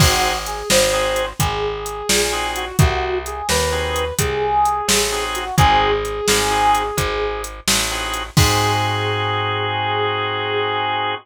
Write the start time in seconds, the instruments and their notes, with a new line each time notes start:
0.00 electric bass (finger) G#1, drawbar organ C4 D#4 F#4 G#4, brass section F#4, kick, crash
0.46 brass section G#4, closed hi-hat
0.70 electric bass (finger) G#1, brass section C5, snare
0.93 drawbar organ C4 D#4 F#4 G#4
1.16 closed hi-hat
1.39 electric bass (finger) G#1, brass section G#4, kick, closed hi-hat
1.86 closed hi-hat
2.09 electric bass (finger) A#1, snare
2.33 drawbar organ C4 D#4 F#4 G#4
2.56 brass section F#4, closed hi-hat
2.79 electric bass (finger) C2, brass section F#4, kick, closed hi-hat
3.26 brass section G#4, closed hi-hat
3.49 electric bass (finger) D#2, brass section B4, snare
3.72 drawbar organ C4 D#4 F#4 G#4
3.96 closed hi-hat
4.19 electric bass (finger) C2, brass section G#4, kick, closed hi-hat
4.65 closed hi-hat
4.88 electric bass (finger) A1, snare
5.12 drawbar organ C4 D#4 F#4 G#4
5.35 brass section F#4, closed hi-hat
5.58 electric bass (finger) G#1, drawbar organ C4 D#4 F#4 G#4, brass section G#4, kick, closed hi-hat
6.05 closed hi-hat
6.28 electric bass (finger) G#1, snare
6.51 drawbar organ C4 D#4 F#4 G#4
6.75 closed hi-hat
6.97 electric bass (finger) G#1, kick, closed hi-hat
7.44 closed hi-hat
7.68 electric bass (finger) A1, snare
7.91 drawbar organ C4 D#4 F#4 G#4
8.14 closed hi-hat
8.37 electric bass (finger) G#2, drawbar organ C4 D#4 F#4 G#4, brass section G#4, kick, crash